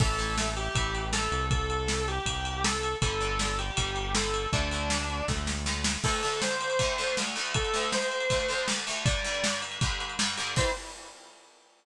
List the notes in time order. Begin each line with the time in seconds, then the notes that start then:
0.00 A1 E3 A3 A4, kick, crash
0.18 E3 A3, ride
0.38 E3 A3, snare
0.56 G4, ride
0.75 A1 E3 A3, kick, ride
0.95 ride
1.13 E3 A3 A4, snare
1.31 C2, ride
1.51 A4, kick, ride
1.70 ride
1.88 snare
2.08 G4, ride
2.26 C2, kick, ride
2.45 ride
2.64 A4, snare
2.83 ride
3.01 G1 D3 G3 A4, kick, ride
3.21 D3 G3, ride
3.39 D3 G3, snare
3.59 G4, ride
3.77 G1 D3 G3, kick, ride
3.96 ride
4.15 D3 G3 A4, snare
4.34 ride
4.53 D2 D3 A3 D4, kick, ride
4.71 D3 A3, ride
4.90 D3 A3, snare
5.10 ride
5.28 D2 D3 A3, kick, snare
5.47 snare
5.66 D3 A3, snare
5.84 snare
6.04 D2 D3 A3 A4, kick, crash
6.13 ride
6.23 D2 D3 A3, ride
6.32 ride
6.41 C5, snare
6.51 ride
6.61 ride
6.70 ride
6.79 D2 D3 A3, kick, ride
6.98 D2 D3 A3, ride
7.08 ride
7.17 D2 D3 A3, snare
7.26 ride
7.36 D2 D3 A3, ride
7.46 ride
7.54 A4, kick, ride
7.65 ride
7.74 D2 D3 A3, ride
7.83 ride
7.92 C5, snare
8.02 ride
8.12 ride
8.20 ride
8.30 D2 D3 A3, kick, ride
8.40 ride
8.49 D2 D3 A3, ride
8.58 ride
8.68 D2 D3 A3, snare
8.78 ride
8.87 D2 D3 A3, ride
8.96 ride
9.05 G2 D3 G3 D5, kick, ride
9.15 ride
9.24 G2 D3 G3, ride
9.34 ride
9.43 G2 D3 G3, snare
9.52 ride
9.62 ride
9.72 ride
9.81 G2 D3 G3, kick, ride
9.90 ride
10.00 ride
10.10 ride
10.19 G2 D3 G3, snare
10.28 ride
10.38 G2 D3 G3, ride
10.47 ride
10.56 E3 G3 C4 C5, kick, crash